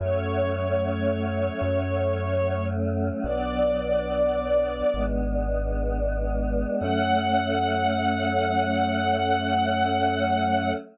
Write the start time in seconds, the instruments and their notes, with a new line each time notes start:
0.00 synth bass 1 F#2, choir aahs F#3 A3 C#4, string ensemble 1 C#5
1.61 synth bass 1 F#2, choir aahs F#3 A3 C#4
3.23 synth bass 1 B1, choir aahs F#3 B3 D4, string ensemble 1 D5
4.94 synth bass 1 G#1, choir aahs G#3 B3 D4
6.80 synth bass 1 F#2, choir aahs F#3 A3 C#4, string ensemble 1 F#5